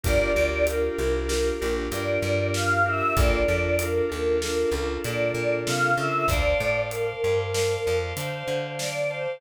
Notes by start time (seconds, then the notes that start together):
0.04 G1 D4 F4 G4 A#4 D5, kick, closed hi-hat
0.35 D2 D4 F4 G4 A#4
0.67 D4 F4 G4 A#4, closed hi-hat
0.98 C2 D4 F4 G4 A#4
1.28 D4 F4 G4 A#4, snare
1.61 A#1 D4 F4 G4 A#4
1.92 G2 D4 F4 G4 A#4 D5, closed hi-hat
2.22 G2
2.54 F5, snare
2.85 D4 F4 G4 A#4 E5
3.16 A#1 D4 F4 A4 A#4 D5, kick, closed hi-hat
3.48 F2 D4 F4 A4 A#4
3.79 D4 F4 A4 A#4, closed hi-hat
4.09 D#2 D4 F4 A4 A#4
4.41 D4 F4 A4 A#4, snare
4.71 C#2 D4 F4 A4 A#4
5.03 A#2 D4 F4 A4 A#4 D5, closed hi-hat
5.34 A#2
5.67 C3 F5, snare
5.97 C#3 D4 F4 A4 A#4 E5
6.28 D2 C5 D5 F5 A5, kick, closed hi-hat
6.60 A2 C5 D5 F5 A5
6.90 A#4 C5 D5 F5 A5, closed hi-hat
7.23 G2 C5 D5 F5 A5
7.53 C5 D5 F5 A5, snare
7.85 F2 C5 D5 F5 A5
8.16 D3 C5 D5 F5 A5, closed hi-hat
8.48 D3
8.79 D5, snare
9.09 C5 D5 F5 A5